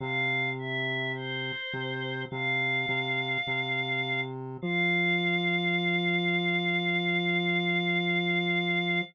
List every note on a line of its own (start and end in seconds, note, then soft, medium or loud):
0.00 1.52 C3 loud
0.00 0.50 F5 medium
0.58 1.12 E5 medium
1.14 2.22 C5 medium
1.73 2.25 C3 loud
2.30 2.86 C3 loud
2.30 4.21 F5 medium
2.88 3.38 C3 loud
3.47 4.57 C3 loud
4.62 9.01 F3 loud
4.62 9.01 F5 loud